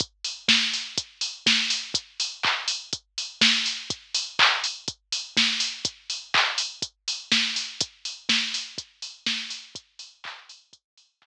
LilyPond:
\new DrumStaff \drummode { \time 4/4 \tempo 4 = 123 <hh bd>8 hho8 <bd sn>8 hho8 <hh bd>8 hho8 <bd sn>8 hho8 | <hh bd>8 hho8 <hc bd>8 hho8 <hh bd>8 hho8 <bd sn>8 hho8 | <hh bd>8 hho8 <hc bd>8 hho8 <hh bd>8 hho8 <bd sn>8 hho8 | <hh bd>8 hho8 <hc bd>8 hho8 <hh bd>8 hho8 <bd sn>8 hho8 |
<hh bd>8 hho8 <bd sn>8 hho8 <hh bd>8 hho8 <bd sn>8 hho8 | <hh bd>8 hho8 <hc bd>8 hho8 <hh bd>8 hho8 <hc bd>4 | }